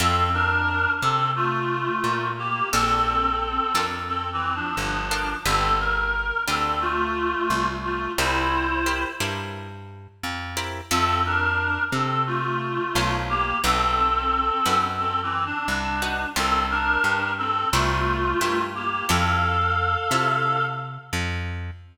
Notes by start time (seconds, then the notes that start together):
0.00 F2 C4 E4 F4 A4
0.34 D4 A#4
1.02 C3 C4 A4
1.36 A3 F4
2.04 A#2
2.38 A#3 G4
2.72 A#1 C4 D4 F4 A4 A#4
3.75 F2 D4 F4 A4 A#4
4.08 C4 A4
4.33 E3 C4
4.55 F3 D4
4.77 G1 F3 D4
5.11 D4 F4 A4 A#4
5.45 G1 C4 D4 F4 G4 A4 B4
5.80 A#4
6.48 D2 C4 D4 F4 G4 A4 B4
6.81 A3 F4
7.50 C2
7.84 A3 F4
8.18 C2 E4 G4 A#4 C5
8.86 E4 G4 A#4 C5
9.20 G2 E4 G4 A#4 C5
10.23 F2
10.57 E4 G4 A#4 C5
10.91 F2 C4 E4 F4 A4 C5
11.25 D4 A#4
11.92 C3 C4 A4
12.27 A3 F4
12.95 B1 E4 F4 A4 C5
13.29 A#3 G4
13.64 B1 C4 D#4 F#4 A4 B4
14.66 F#2 D#4 F#4 B4
14.99 C4 A4
15.23 E3 C4
15.46 D4
15.68 C2 D4
16.02 D#4 F#4 B4
16.36 C2 C4 F4 G4 A4 A#4 C5
16.70 D4 A#4
17.04 G2
17.38 C4 A4
17.72 C2 A3 E4 F4 G4 A#4 C5
18.41 G2 E4 G4 A#4 C5
18.75 A#3 G4
19.09 F2 E4 F4 A4 C5 F5
20.11 C3 E4 F4 A4 C5
21.13 F2